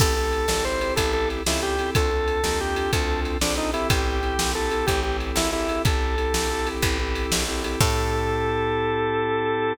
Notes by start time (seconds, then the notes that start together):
0.00 A1 C4 E4 G4 A4, kick, crash
0.16 C4 E4 G4 A4
0.33 ride
0.48 G#1 C4 E4 G4 A4, snare
0.65 C4 E4 G4 A4 C5
0.81 C4 E4 G4 A4, ride
0.96 A1 C4 E4 G4 A4, kick, ride
1.13 A4
1.30 ride
1.46 C#2 C4 E4 G4 A4, snare
1.62 G4
1.79 C4 E4 G4 A4, ride
1.95 D2 C4 D4 F4 A4, kick, ride
2.11 C4 D4 F4 A4
2.28 ride
2.44 D#2 C4 D4 F4 A4, snare
2.60 C4 D4 F4 G4 A4
2.76 C4 D4 F4 A4, ride
2.93 D2 C4 D4 F4 A4, kick, ride
3.25 ride
3.41 A#1 C4 D4 F4 A4, snare
3.58 D#4
3.73 C4 E4 G4 A4, ride
3.90 A1 G4, kick, ride
4.23 C4 E4 G4 A4, ride
4.39 A#1 C4 E4 G4 A4, snare
4.55 C4 E4 G4 A4
4.71 C4 E4 G4 A4, ride
4.87 A1 C4 E4 G4 A4, kick, ride
5.03 C4 E4 G4 A4
5.20 ride
5.36 G#1 E4, snare
5.53 C4 E4 G4 A4
5.69 C4 E4 G4 A4, ride
5.85 A1 C4 E4 G4 A4, kick, ride
6.18 C4 E4 G4 A4, ride
6.34 A#1 C4 E4 G4 A4, snare
6.51 C4 E4 G4 A4
6.67 C4 E4 G4 A4, ride
6.82 A1 C4 E4 G4 A4, kick, ride
7.00 C4 E4 G4 A4
7.15 ride
7.32 A#1, snare
7.48 C4 E4 G4 A4
7.64 C4 E4 G4 A4, ride
7.81 A2 C4 E4 G4 A4, kick, crash